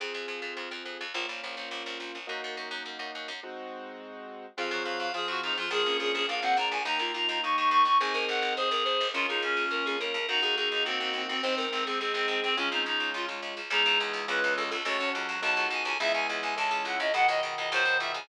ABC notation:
X:1
M:2/2
L:1/8
Q:1/2=105
K:Db
V:1 name="Clarinet"
z8 | z8 | z8 | z8 |
f2 f f A G E F | A2 A A f g b a | b2 b b d' d' d' d' | a2 g2 A4 |
F E D4 z2 | E2 E E C C C C | C2 C C C C C C | D E E2 F z3 |
[K:C#m] D2 z2 B2 A A | c2 z2 a2 g g | e g z g a2 f d | f d z d ^B2 e g |]
V:2 name="Drawbar Organ"
z8 | z8 | z8 | z8 |
F, G, G,2 F,3 F, | F, ^C3 =D =C D2 | E F F2 E3 E | E B3 c B c2 |
D A3 B A B2 | G A A2 G3 G | c B2 A A4 | A, C A,3 z3 |
[K:C#m] [E,G,]8 | A, C F,4 z2 | [E,G,]8 | [B,,D,]8 |]
V:3 name="Acoustic Grand Piano"
[CFA]8 | [B,DF]8 | [B,EG]8 | [A,CEG]8 |
[CFA]4 [CFA]4 | [B,=DFA]4 [B,DFA]4 | [B,E=G]8 | [CEA]8 |
[B,DF]8 | [B,EG]8 | [A,CE]8 | [A,DF]8 |
[K:C#m] [B,DG]4 [B,C^EG]4 | [CFA]4 [B,DFA]4 | [B,EG]4 [CEA]4 | z8 |]
V:4 name="Harpsichord" clef=bass
F,, F,, F,, F,, F,, F,, F,, F,, | B,,, B,,, B,,, B,,, B,,, B,,, B,,, B,,, | G,, G,, G,, G,, G,, G,, G,, G,, | z8 |
F,, F,, F,, F,, F,, F,, F,, F,, | B,,, B,,, B,,, B,,, B,,, B,,, B,,, B,,, | E,, E,, E,, E,, E,, E,, E,, E,, | A,,, A,,, A,,, A,,, A,,, A,,, A,,, A,,, |
D,, D,, D,, D,, D,, D,, D,, D,, | E,, E,, E,, E,, E,, E,, E,, E,, | A,,, A,,, A,,, A,,, A,,, A,,, A,,, A,,, | D,, D,, D,, D,, D,, D,, D,, D,, |
[K:C#m] C,, C,, C,, C,, C,, C,, C,, C,, | C,, C,, C,, C,, C,, C,, C,, C,, | C,, C,, C,, C,, C,, C,, C,, C,, | C,, C,, C,, C,, C,, C,, C,, C,, |]